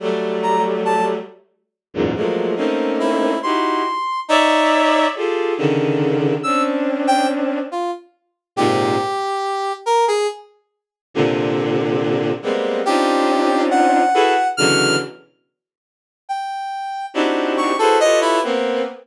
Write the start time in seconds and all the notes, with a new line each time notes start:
0.00 F#3 G3 A3
0.43 A#5
0.85 A5
1.94 E2 F#2 G#2 A#2
2.15 F3 F#3 G#3 A3 A#3
2.56 A3 A#3 C4 C#4 D#4
3.00 E4
3.43 D#4 E4 F#4 G4 C6
4.28 D#4 C#5 D5 E5
5.15 F4 G4 G#4 A4
5.57 C#3 D3 D#3
6.43 C4 C#4 D4 E6
7.07 G5
7.72 F4
8.56 G#2 A#2 C3 G4
9.86 A#4
10.08 G#4
11.14 A#2 C3 D3
12.42 G3 G#3 A#3 B3 C4
12.85 C4 C#4 D4 D#4 F4 G4
13.71 F#5
14.14 E4 F#4 G#4 A4 B4
14.57 B2 C#3 D3 E3 F#3 F6
16.29 G5
17.14 C4 D4 D#4 E4 F#4 G4
17.57 C#6
17.79 E4 F#4 G#4 A4 B4 C5
18.00 F4 G4 A4 B4 C#5 D#5
18.21 E4
18.43 A#3 B3 C4